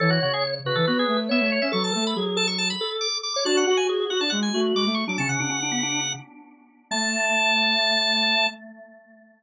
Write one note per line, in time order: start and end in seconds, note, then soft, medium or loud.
0.00 0.19 E3 loud
0.00 0.10 A4 loud
0.00 0.54 C#5 loud
0.10 0.20 F#4 medium
0.22 0.59 C#3 medium
0.22 0.33 F#4 medium
0.34 0.44 G#4 medium
0.65 0.75 C#3 loud
0.65 0.77 F#4 medium
0.65 1.20 B4 medium
0.75 0.86 E3 loud
0.75 0.86 A4 medium
0.87 1.05 B3 loud
0.87 0.98 F#4 medium
0.99 1.17 G#4 medium
1.08 1.29 A3 loud
1.29 1.40 B3 loud
1.29 1.68 C#5 medium
1.29 1.50 E5 medium
1.40 1.59 A3 loud
1.52 1.62 C#5 medium
1.62 1.72 C#4 loud
1.62 1.72 E5 medium
1.72 1.91 F#3 loud
1.72 1.93 A4 loud
1.72 1.83 C#6 medium
1.84 1.94 A5 medium
1.93 2.14 A3 loud
1.93 2.13 A4 medium
1.93 2.05 A5 medium
2.07 2.17 B5 medium
2.16 2.72 F#3 loud
2.16 2.25 G#4 medium
2.26 2.36 G#4 medium
2.36 2.46 A4 loud
2.36 2.47 A5 medium
2.48 2.58 C#6 medium
2.58 2.69 A5 medium
2.70 2.90 B5 medium
2.81 3.07 A4 medium
3.01 3.18 D6 medium
3.23 3.33 D6 medium
3.34 3.46 C#5 loud
3.34 3.44 D6 medium
3.45 3.65 D4 loud
3.45 3.66 F#4 loud
3.45 3.56 A5 medium
3.57 3.67 F#5 medium
3.67 3.85 F#4 medium
3.67 4.04 F#4 loud
3.67 3.77 F#5 medium
3.77 3.87 G#5 medium
3.89 3.99 G#4 medium
4.00 4.10 G#4 medium
4.10 4.20 F#4 loud
4.10 4.21 F#4 loud
4.10 4.20 F#5 medium
4.20 4.31 D4 loud
4.20 4.31 A5 medium
4.30 4.49 G#3 loud
4.30 4.40 F#5 medium
4.43 4.60 G#5 medium
4.54 4.73 A3 loud
4.54 4.84 F#4 medium
4.75 4.85 G#3 loud
4.75 4.95 D6 medium
4.86 5.04 A3 loud
4.94 5.05 C#6 medium
5.07 5.17 F#3 medium
5.07 5.18 D4 medium
5.07 5.19 D6 medium
5.18 5.28 C#3 loud
5.18 5.40 C#4 loud
5.18 5.28 A5 medium
5.29 5.39 C#3 medium
5.29 6.13 F#5 medium
5.39 6.14 C#3 medium
5.39 5.50 D4 medium
5.49 5.60 C#4 loud
5.62 5.73 D4 medium
5.71 5.82 B3 medium
5.83 6.00 D4 medium
6.91 8.46 A3 loud
6.91 8.47 A5 loud